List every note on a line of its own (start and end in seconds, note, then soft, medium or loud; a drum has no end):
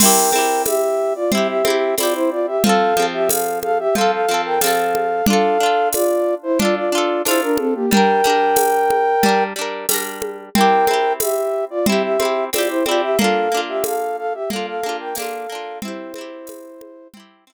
0.00 0.30 C4 loud
0.00 0.30 E4 loud
0.00 0.63 A#4 medium
0.00 0.63 G5 loud
0.00 crash loud
0.00 low conga loud
0.05 0.30 G4 loud
0.32 1.24 C4 medium
0.32 1.24 E4 loud
0.32 high conga medium
0.38 1.24 G4 medium
0.66 1.13 G4 medium
0.66 1.13 E5 loud
0.66 tambourine medium
0.66 high conga loud
1.15 1.31 F4 medium
1.15 1.31 D5 medium
1.32 1.62 C4 medium
1.32 1.62 E4 loud
1.32 1.48 G4 medium
1.32 1.48 E5 medium
1.32 low conga loud
1.38 1.62 G4 medium
1.48 1.95 G4 medium
1.48 1.95 E5 loud
1.65 1.95 C4 loud
1.65 1.95 E4 loud
1.65 high conga loud
1.70 1.95 G4 loud
1.98 2.58 C4 medium
1.98 2.58 E4 medium
1.98 2.13 F4 medium
1.98 2.13 D5 medium
1.98 tambourine medium
1.98 high conga medium
2.03 2.58 G4 medium
2.14 2.30 E4 medium
2.14 2.30 C5 loud
2.31 2.46 F4 medium
2.31 2.46 D5 medium
2.47 2.63 G4 medium
2.47 2.63 E5 medium
2.64 2.94 F3 loud
2.64 2.94 C4 loud
2.64 3.06 A4 loud
2.64 3.06 F5 loud
2.64 low conga loud
2.69 2.94 A4 loud
2.97 3.88 F3 medium
2.97 3.88 C4 medium
2.97 high conga medium
3.02 3.88 A4 medium
3.13 3.29 G4 medium
3.13 3.29 E5 loud
3.29 3.59 A4 medium
3.29 3.59 F5 medium
3.29 tambourine loud
3.29 high conga medium
3.63 3.78 A4 medium
3.63 3.78 F5 loud
3.63 high conga medium
3.79 3.95 G4 medium
3.79 3.95 E5 loud
3.95 4.26 F3 medium
3.95 4.26 C4 medium
3.95 4.11 A4 loud
3.95 4.11 F5 loud
3.95 low conga medium
4.01 4.26 A4 medium
4.12 4.41 A4 medium
4.12 4.41 F5 medium
4.29 4.59 F3 medium
4.29 4.59 C4 medium
4.34 4.59 A4 medium
4.45 4.61 A#4 medium
4.45 4.61 G5 medium
4.61 5.22 F3 loud
4.61 5.22 C4 loud
4.61 5.25 A4 medium
4.61 5.25 F5 medium
4.61 tambourine loud
4.61 high conga loud
4.67 5.22 A4 loud
4.95 high conga medium
5.26 5.58 D4 loud
5.26 5.58 F4 loud
5.26 5.89 A4 loud
5.26 5.89 F5 loud
5.26 low conga loud
5.33 5.58 A4 loud
5.60 6.51 D4 medium
5.60 6.51 F4 medium
5.66 6.51 A4 medium
5.93 6.35 F4 medium
5.93 6.35 D5 loud
5.93 tambourine medium
5.93 high conga medium
6.43 6.59 E4 medium
6.43 6.59 C5 loud
6.59 6.90 D4 medium
6.59 6.75 F4 medium
6.59 6.90 F4 medium
6.59 6.75 D5 loud
6.59 low conga loud
6.65 6.90 A4 medium
6.76 7.22 F4 medium
6.76 7.22 D5 medium
6.92 7.23 D4 medium
6.92 7.23 F4 loud
6.98 7.23 A4 loud
7.25 7.86 D4 medium
7.25 7.41 E4 medium
7.25 7.86 F4 loud
7.25 7.41 C5 loud
7.25 tambourine medium
7.25 high conga medium
7.31 7.86 A4 medium
7.42 7.57 D4 medium
7.42 7.57 A#4 loud
7.58 7.74 C4 medium
7.58 7.74 A4 medium
7.58 high conga medium
7.75 7.90 A#3 medium
7.75 7.90 G4 medium
7.91 8.22 G3 loud
7.91 8.22 D4 medium
7.91 9.44 A#4 loud
7.91 9.44 G5 loud
7.91 low conga loud
7.97 8.22 A#4 loud
8.24 9.15 G3 medium
8.24 9.15 D4 medium
8.24 high conga medium
8.30 9.15 A#4 medium
8.56 tambourine medium
8.56 high conga loud
8.90 high conga medium
9.23 9.53 G3 loud
9.23 9.53 D4 medium
9.23 low conga loud
9.29 9.53 A#4 medium
9.56 9.86 G3 medium
9.56 9.86 D4 medium
9.61 9.86 A#4 medium
9.89 10.50 G3 medium
9.89 10.50 D4 medium
9.89 tambourine loud
9.89 high conga medium
9.94 10.50 A#4 medium
10.22 high conga medium
10.55 10.85 C4 loud
10.55 10.85 E4 medium
10.55 11.13 A#4 loud
10.55 11.13 G5 loud
10.55 low conga loud
10.61 10.85 G4 loud
10.87 11.79 C4 medium
10.87 11.79 E4 medium
10.87 high conga medium
10.93 11.79 G4 medium
11.20 11.65 G4 medium
11.20 11.65 E5 medium
11.20 tambourine medium
11.20 high conga loud
11.70 11.86 F4 medium
11.70 11.86 D5 medium
11.86 12.17 C4 loud
11.86 12.17 E4 medium
11.86 12.02 G4 medium
11.86 12.02 E5 medium
11.86 low conga loud
11.92 12.17 G4 medium
12.03 12.45 G4 medium
12.03 12.45 E5 medium
12.20 12.50 C4 medium
12.20 12.50 E4 medium
12.20 high conga medium
12.25 12.50 G4 medium
12.53 12.83 C4 medium
12.53 12.83 E4 medium
12.53 12.68 F4 medium
12.53 12.68 D5 medium
12.53 tambourine medium
12.53 high conga loud
12.58 12.83 G4 medium
12.69 12.85 E4 medium
12.69 12.85 C5 medium
12.86 13.16 C4 medium
12.86 13.16 E4 medium
12.86 13.01 F4 medium
12.86 13.01 D5 medium
12.86 high conga medium
12.91 13.16 G4 loud
13.02 13.18 G4 medium
13.02 13.18 E5 loud
13.19 13.49 A#3 loud
13.19 13.49 D4 loud
13.19 13.61 A4 medium
13.19 13.61 F5 loud
13.19 low conga loud
13.24 13.49 F4 loud
13.52 14.43 A#3 medium
13.52 14.43 D4 medium
13.57 14.43 F4 medium
13.68 13.84 G4 medium
13.68 13.84 E5 medium
13.84 14.17 A4 medium
13.84 14.17 F5 medium
13.84 tambourine medium
13.84 high conga loud
14.18 14.33 A4 medium
14.18 14.33 F5 loud
14.34 14.50 G4 medium
14.34 14.50 E5 medium
14.50 14.81 A#3 medium
14.50 14.81 D4 medium
14.50 14.66 A4 medium
14.50 14.66 F5 medium
14.50 low conga medium
14.56 14.81 F4 medium
14.67 14.97 A4 medium
14.67 14.97 F5 loud
14.83 15.14 A#3 medium
14.83 15.14 D4 medium
14.83 high conga medium
14.89 15.14 F4 loud
15.00 15.16 A#4 medium
15.00 15.16 G5 medium
15.15 15.47 A#3 loud
15.15 15.47 D4 medium
15.15 15.79 A4 medium
15.15 15.79 F5 loud
15.15 tambourine loud
15.15 high conga loud
15.22 15.47 F4 medium
15.49 15.80 A#3 medium
15.49 15.80 D4 medium
15.55 15.80 F4 medium
15.82 16.13 C4 loud
15.82 17.08 E4 medium
15.82 16.13 E4 loud
15.82 17.08 C5 medium
15.82 low conga loud
15.88 16.13 G4 loud
16.14 17.06 C4 medium
16.14 high conga medium
16.18 17.06 E4 medium
16.18 17.06 G4 loud
16.47 tambourine medium
16.47 high conga loud
16.81 high conga medium
17.14 17.45 C4 medium
17.14 17.45 E4 medium
17.14 low conga loud
17.20 17.45 G4 loud
17.47 17.53 C4 medium
17.47 17.53 E4 loud
17.53 17.53 G4 loud